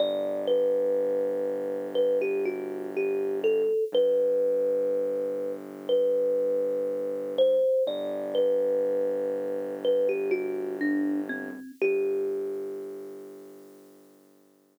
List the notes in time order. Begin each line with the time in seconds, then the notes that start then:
0.00 G1 D5
0.48 B4
1.95 B4
2.22 G4
2.45 F#4
2.97 G4
3.44 A4
3.92 G1 B4
5.89 B4
7.38 C5
7.87 G1 D5
8.35 B4
9.85 B4
10.09 G4
10.31 F#4
10.81 D4
11.29 C4
11.82 G1 G4